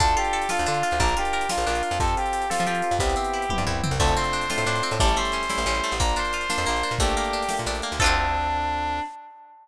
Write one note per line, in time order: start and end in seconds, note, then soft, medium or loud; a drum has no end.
0.00 0.15 D2 loud
0.00 0.66 D4 medium
0.00 0.45 D4 loud
0.00 0.45 F4 loud
0.00 0.14 A4 loud
0.00 0.45 A4 loud
0.00 kick loud
0.00 closed hi-hat loud
0.08 closed hi-hat medium
0.17 0.49 F4 medium
0.17 0.49 G4 medium
0.17 closed hi-hat medium
0.25 closed hi-hat medium
0.33 0.97 A4 medium
0.33 closed hi-hat medium
0.42 closed hi-hat medium
0.49 0.95 D4 loud
0.49 0.83 F4 medium
0.49 0.64 F4 medium
0.49 0.95 F4 loud
0.49 0.95 A4 loud
0.49 snare loud
0.57 0.67 D2 loud
0.57 closed hi-hat medium
0.66 0.83 D3 medium
0.66 0.98 D4 medium
0.66 0.98 F4 medium
0.66 closed hi-hat medium
0.74 closed hi-hat medium
0.83 0.99 F4 medium
0.83 closed hi-hat medium
0.91 1.00 D2 medium
0.91 closed hi-hat medium
1.00 1.15 A#1 loud
1.00 1.66 D4 medium
1.00 1.45 D4 loud
1.00 1.45 F4 loud
1.00 1.16 A#4 loud
1.00 1.45 A#4 loud
1.00 kick loud
1.00 closed hi-hat loud
1.08 closed hi-hat medium
1.17 1.49 F4 medium
1.17 1.48 G4 loud
1.17 closed hi-hat medium
1.25 closed hi-hat medium
1.33 1.97 A#4 medium
1.33 closed hi-hat medium
1.41 closed hi-hat medium
1.49 1.95 D4 medium
1.49 1.83 F4 medium
1.49 1.95 F4 loud
1.49 1.65 F4 medium
1.49 1.95 A#4 medium
1.49 snare loud
1.58 1.65 A#1 medium
1.58 closed hi-hat medium
1.66 1.82 A#1 loud
1.66 1.98 D4 medium
1.66 1.97 F4 medium
1.66 closed hi-hat medium
1.75 closed hi-hat medium
1.83 1.99 F4 medium
1.83 closed hi-hat medium
1.91 1.99 F2 loud
1.91 closed hi-hat medium
2.00 2.15 F2 loud
2.00 2.45 C4 loud
2.00 2.95 C4 medium
2.00 2.45 F4 loud
2.00 2.45 G4 loud
2.00 2.14 A4 medium
2.00 2.45 A4 loud
2.00 kick loud
2.00 closed hi-hat loud
2.08 closed hi-hat medium
2.17 2.83 F4 medium
2.17 2.48 G4 medium
2.17 closed hi-hat medium
2.26 closed hi-hat medium
2.33 2.66 G4 medium
2.33 closed hi-hat medium
2.42 closed hi-hat medium
2.50 2.95 C4 medium
2.50 2.64 F4 medium
2.50 2.95 F4 medium
2.50 2.95 G4 loud
2.50 2.98 A4 medium
2.50 2.95 A4 loud
2.50 snare loud
2.58 2.67 F3 loud
2.58 closed hi-hat medium
2.67 2.82 F3 medium
2.67 2.96 F4 medium
2.67 2.98 G4 medium
2.67 closed hi-hat medium
2.75 closed hi-hat medium
2.82 3.00 F4 medium
2.82 closed hi-hat medium
2.91 2.99 F2 medium
2.91 closed hi-hat medium
2.99 3.15 C2 loud
2.99 3.95 B3 medium
2.99 3.45 B3 loud
2.99 3.45 C4 loud
2.99 3.45 E4 loud
2.99 3.61 G4 loud
2.99 3.45 G4 loud
2.99 kick loud
2.99 closed hi-hat loud
3.10 closed hi-hat medium
3.16 3.83 C4 medium
3.16 closed hi-hat medium
3.24 closed hi-hat medium
3.33 3.66 E4 medium
3.33 closed hi-hat medium
3.42 closed hi-hat medium
3.50 3.95 B3 loud
3.50 3.95 C4 loud
3.50 3.95 E4 loud
3.50 3.98 G4 medium
3.50 3.95 G4 medium
3.50 kick medium
3.50 high tom medium
3.58 3.65 G2 loud
3.67 3.82 C2 medium
3.67 3.98 E4 medium
3.67 floor tom medium
3.84 3.99 C4 medium
3.84 mid tom loud
3.91 3.99 C2 loud
4.00 4.15 D2 loud
4.00 4.95 A3 medium
4.00 4.45 A3 loud
4.00 4.45 C4 loud
4.00 4.45 D4 loud
4.00 4.45 F4 loud
4.00 4.14 A4 medium
4.00 kick loud
4.00 crash loud
4.07 closed hi-hat medium
4.17 4.83 C4 medium
4.17 4.88 C5 medium
4.17 closed hi-hat medium
4.24 closed hi-hat medium
4.33 4.66 D4 medium
4.33 closed hi-hat medium
4.42 closed hi-hat medium
4.50 4.95 A3 loud
4.50 4.95 C4 loud
4.50 4.95 D4 loud
4.50 4.95 F4 loud
4.50 4.98 F4 medium
4.50 snare loud
4.58 4.65 A2 medium
4.58 closed hi-hat medium
4.66 4.81 A2 loud
4.66 4.98 D4 medium
4.66 closed hi-hat medium
4.76 closed hi-hat medium
4.83 4.99 C4 medium
4.83 closed hi-hat medium
4.91 4.99 A2 loud
4.91 closed hi-hat medium
5.00 5.16 A1 loud
5.00 5.45 G3 loud
5.00 5.95 G3 medium
5.00 5.45 A3 loud
5.00 5.45 C#4 loud
5.00 5.45 E4 loud
5.00 5.16 A4 loud
5.00 kick loud
5.00 closed hi-hat loud
5.08 closed hi-hat medium
5.16 5.83 A3 medium
5.16 5.92 C5 medium
5.16 closed hi-hat medium
5.25 closed hi-hat medium
5.32 5.66 C#4 medium
5.32 closed hi-hat medium
5.43 closed hi-hat medium
5.50 5.95 G3 medium
5.50 5.95 A3 loud
5.50 5.95 C#4 medium
5.50 5.95 E4 loud
5.50 5.98 E4 medium
5.50 snare loud
5.58 5.65 A1 medium
5.58 closed hi-hat medium
5.66 5.81 A1 loud
5.66 5.98 C#4 medium
5.66 closed hi-hat medium
5.75 closed hi-hat medium
5.84 6.00 A3 medium
5.84 closed hi-hat medium
5.92 6.00 A1 medium
5.92 closed hi-hat medium
6.00 6.15 A#1 loud
6.00 6.66 A#3 medium
6.00 6.45 A#3 loud
6.00 6.45 D4 loud
6.00 6.45 F4 loud
6.00 6.16 A#4 loud
6.00 kick loud
6.00 closed hi-hat loud
6.09 closed hi-hat medium
6.16 6.50 D4 medium
6.16 6.90 C5 medium
6.16 closed hi-hat medium
6.25 closed hi-hat medium
6.33 6.97 F4 medium
6.33 closed hi-hat medium
6.41 closed hi-hat medium
6.50 6.95 A#3 loud
6.50 6.95 D4 loud
6.50 6.83 D4 medium
6.50 6.95 F4 loud
6.50 snare loud
6.58 6.66 F2 medium
6.58 closed hi-hat medium
6.66 6.83 A#1 medium
6.66 6.98 A#3 medium
6.66 closed hi-hat medium
6.76 closed hi-hat medium
6.83 6.99 D4 medium
6.83 closed hi-hat medium
6.91 6.99 A#2 medium
6.91 closed hi-hat medium
6.99 7.15 A#1 loud
6.99 7.45 A3 loud
6.99 7.95 A3 medium
6.99 7.45 A#3 loud
6.99 7.45 D4 loud
6.99 7.45 G4 loud
6.99 7.54 G4 loud
6.99 kick loud
6.99 closed hi-hat loud
7.08 closed hi-hat medium
7.17 7.83 A#3 medium
7.17 closed hi-hat medium
7.24 closed hi-hat medium
7.33 7.66 D4 medium
7.33 closed hi-hat medium
7.42 closed hi-hat medium
7.49 7.95 A3 loud
7.49 7.95 A#3 medium
7.49 7.95 D4 medium
7.49 7.95 G4 loud
7.49 7.98 G4 medium
7.49 snare loud
7.57 7.67 A#2 medium
7.57 closed hi-hat medium
7.66 7.81 A#1 medium
7.66 7.98 D4 medium
7.66 closed hi-hat medium
7.75 closed hi-hat medium
7.82 7.99 A#3 medium
7.82 closed hi-hat medium
7.92 7.99 D2 medium
7.92 closed hi-hat medium
8.00 9.00 D2 loud
8.00 8.99 C4 loud
8.00 8.99 D4 medium
8.00 8.99 D4 loud
8.00 8.99 F4 loud
8.00 8.99 F4 medium
8.00 8.99 A4 medium
8.00 8.99 A4 loud
8.00 kick loud
8.00 crash loud
8.04 8.99 C4 loud
8.04 8.99 D4 medium